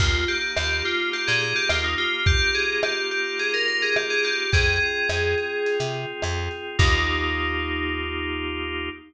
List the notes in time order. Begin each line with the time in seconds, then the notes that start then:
0.00 D#2 A#3 F4, kick, crash
0.28 D#4 G4, closed hi-hat
0.56 D#2 F4 G4, cross-stick
0.84 F4 G4, closed hi-hat
1.13 A#3 G4, closed hi-hat
1.27 A#2 G#4
1.41 D#4 G#4, closed hi-hat
1.56 G4
1.69 D#2 F4, cross-stick
1.84 D#4
1.98 F4 G4, closed hi-hat
2.26 A#3 G4, kick, closed hi-hat
2.54 D#4 G#4, closed hi-hat
2.83 F4 G4, cross-stick
3.11 G4, closed hi-hat
3.38 A#3 G#4, closed hi-hat
3.54 A#4
3.67 D#4 A#4, closed hi-hat
3.82 G#4
3.96 F4 G4, cross-stick
4.10 G#4
4.24 G4, closed hi-hat
4.52 F2 C4 G#4, kick, closed hi-hat
4.81 F4, closed hi-hat
5.09 F2 G#4, cross-stick
5.38 C4, closed hi-hat
5.66 F4, closed hi-hat
5.80 C3
5.94 G#4, closed hi-hat
6.22 F2 C4, cross-stick
6.51 F4, closed hi-hat
6.79 D#2 A#3 D#4 F4 G4, kick, crash